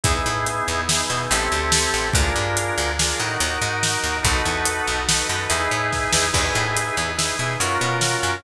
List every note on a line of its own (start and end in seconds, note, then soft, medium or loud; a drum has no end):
0.03 0.23 E2 medium
0.03 0.81 B3 medium
0.03 0.81 D#4 medium
0.03 0.81 E4 medium
0.03 0.81 G#4 medium
0.03 kick loud
0.03 closed hi-hat loud
0.26 0.62 A2 medium
0.46 closed hi-hat medium
0.68 1.03 E2 medium
0.89 1.10 B3 medium
0.89 1.10 D#4 medium
0.89 1.10 E4 medium
0.89 1.10 G#4 medium
0.89 snare loud
1.10 1.28 B2 medium
1.10 1.31 B3 medium
1.10 1.31 D#4 medium
1.10 1.30 E4 medium
1.10 1.31 G#4 medium
1.30 1.49 A1 medium
1.30 2.08 C4 medium
1.30 2.08 E4 medium
1.30 2.08 G4 loud
1.30 2.08 A4 medium
1.30 closed hi-hat loud
1.52 1.87 D2 medium
1.72 snare loud
1.94 2.12 A1 medium
2.13 2.33 D2 medium
2.13 2.90 D4 medium
2.13 2.90 F4 medium
2.13 2.90 G#4 medium
2.13 2.90 A#4 medium
2.13 kick loud
2.13 closed hi-hat loud
2.36 2.71 G2 medium
2.57 closed hi-hat loud
2.78 3.13 D2 medium
2.99 3.19 D4 medium
2.99 3.19 F4 medium
2.99 3.19 G#4 medium
2.99 3.18 A#4 medium
2.99 snare loud
3.19 3.37 A2 medium
3.19 4.17 D#4 medium
3.19 4.17 F#4 medium
3.19 4.17 A#4 medium
3.40 3.58 D#2 medium
3.40 closed hi-hat medium
3.62 3.97 G#2 medium
3.83 snare loud
4.03 4.21 D#2 medium
4.23 4.42 B1 medium
4.23 5.00 D#4 loud
4.23 5.00 F#4 medium
4.23 5.00 A4 medium
4.23 5.00 B4 medium
4.23 kick loud
4.23 closed hi-hat loud
4.45 4.81 E2 medium
4.65 closed hi-hat loud
4.87 5.23 B1 medium
5.08 5.28 D#4 medium
5.08 5.28 F#4 medium
5.08 5.28 A4 medium
5.08 5.28 B4 medium
5.08 snare loud
5.29 5.47 F#2 medium
5.29 5.48 D#4 medium
5.29 5.48 F#4 medium
5.29 5.48 A4 medium
5.29 5.48 B4 medium
5.49 5.68 E2 medium
5.49 6.26 D#4 loud
5.49 6.26 E4 medium
5.49 6.26 G#4 loud
5.49 6.26 B4 medium
5.49 closed hi-hat loud
5.71 6.07 A2 medium
5.92 kick medium
5.92 snare medium
6.12 6.31 E2 medium
6.12 snare loud
6.33 6.52 E2 medium
6.33 7.10 D#4 medium
6.33 7.10 E4 medium
6.33 7.10 G#4 medium
6.33 7.10 B4 medium
6.33 kick medium
6.33 crash loud
6.55 6.91 A2 medium
6.77 closed hi-hat loud
6.97 7.33 E2 medium
7.17 7.36 D#4 medium
7.17 7.36 E4 medium
7.17 7.36 G#4 medium
7.17 7.36 B4 medium
7.17 snare loud
7.39 7.57 B2 medium
7.39 7.58 D#4 medium
7.39 7.58 E4 medium
7.39 7.58 G#4 medium
7.39 7.58 B4 medium
7.60 7.78 F#2 medium
7.60 8.37 C#4 medium
7.60 8.37 F4 medium
7.60 8.37 F#4 medium
7.60 8.37 A#4 medium
7.60 closed hi-hat loud
7.81 8.17 B2 medium
8.01 snare loud
8.23 8.41 F#2 medium